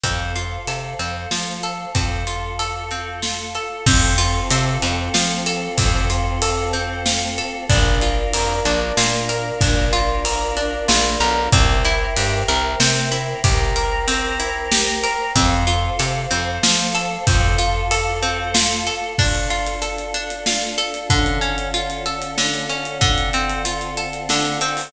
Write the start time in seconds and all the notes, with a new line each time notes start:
0.03 F2 C4 A4 C5 F5, kick, ride
0.36 F4, ride
0.67 C3 A4, ride
0.99 F2 C4, ride
1.31 F3 F4, snare
1.63 A4, ride
1.95 F2 C4 F4 A4 F5, kick, ride
2.27 F4, ride
2.59 A4, ride
2.91 C4, ride
3.22 F4, snare
3.55 A4, ride
3.86 F2 C4 F4 A4, kick, crash
4.18 F4, ride
4.50 C3 A4, ride
4.82 F2 C4, ride
5.14 F3 F4, snare
5.46 A4, ride
5.78 F2 C4, kick, ride
6.10 F4, ride
6.42 A4, ride
6.73 C4, ride
7.06 F4, snare
7.38 A4, ride
7.69 A#1 D4 F4 A#4, kick, ride
8.01 F4, ride
8.33 F2 A#4, ride
8.65 A#1 D4, ride
8.97 A#2 F4, snare
9.29 A#4, ride
9.61 A#1 D4, kick, ride
9.93 F4, ride
10.25 A#4, ride
10.57 D4, ride
10.88 A#1 F4, snare
11.20 B1 A#4, ride
11.52 C2 C4 A#4 C5 E5 G5, kick, ride
11.85 E4, ride
12.16 G2 G4, ride
12.48 C2 A#4, ride
12.80 C3 C4, snare
13.12 E4, ride
13.44 C2 G4 A#4 C5 G5 A#5, kick, ride
13.76 A#4, ride
14.08 C4, ride
14.40 E4, ride
14.71 G4, snare
15.03 A#4, ride
15.35 F2 C4 A4 C5 F5, kick, ride
15.67 F4, ride
15.99 C3 A4, ride
16.31 F2 C4, ride
16.63 F3 F4, snare
16.95 A4, ride
17.26 F2 C4 F4 A4 F5, kick, ride
17.58 F4, ride
17.91 A4, ride
18.22 C4, ride
18.54 F4, snare
18.87 A4, ride
19.18 D4 F4 A4, kick, crash
19.35 closed hi-hat
19.50 F4, closed hi-hat
19.66 closed hi-hat
19.82 A4, closed hi-hat
19.98 closed hi-hat
20.14 D4, closed hi-hat
20.30 closed hi-hat
20.46 F4, snare
20.62 closed hi-hat
20.78 A4, closed hi-hat
20.94 closed hi-hat
21.10 D3 C#4 F4 A4, kick, closed hi-hat
21.26 closed hi-hat
21.41 C#4, closed hi-hat
21.58 closed hi-hat
21.74 F4, closed hi-hat
21.90 closed hi-hat
22.06 A4, closed hi-hat
22.22 closed hi-hat
22.38 D3, snare
22.54 closed hi-hat
22.69 C#4, closed hi-hat
22.85 closed hi-hat
23.01 D3 C4 F4 A4, kick, closed hi-hat
23.18 closed hi-hat
23.33 C4, closed hi-hat
23.49 closed hi-hat
23.65 F4, closed hi-hat
23.81 closed hi-hat
23.97 A4, closed hi-hat
24.13 closed hi-hat
24.29 D3, snare
24.45 closed hi-hat
24.61 C4, closed hi-hat
24.77 open hi-hat